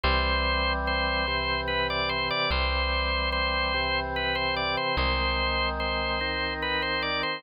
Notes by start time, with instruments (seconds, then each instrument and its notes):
0.04 electric bass (finger) C2, drawbar organ E3 G3 C4 C5
0.87 drawbar organ C5
1.28 drawbar organ C3 E3 C4
1.68 drawbar organ B4
1.90 drawbar organ D5
2.09 drawbar organ C5
2.30 drawbar organ D5
2.51 electric bass (finger) C2, drawbar organ E3 G3 C4 C5
3.32 drawbar organ C5
3.74 drawbar organ C3 E3 C4
4.16 drawbar organ B4
4.35 drawbar organ C5
4.57 drawbar organ D5
4.77 drawbar organ C5
4.97 electric bass (finger) C2, drawbar organ D#3 G#3 C4 C5
5.80 drawbar organ C5
6.21 drawbar organ D#3 C4 D#4
6.62 drawbar organ B4
6.82 drawbar organ C5
7.02 drawbar organ D5
7.23 drawbar organ C5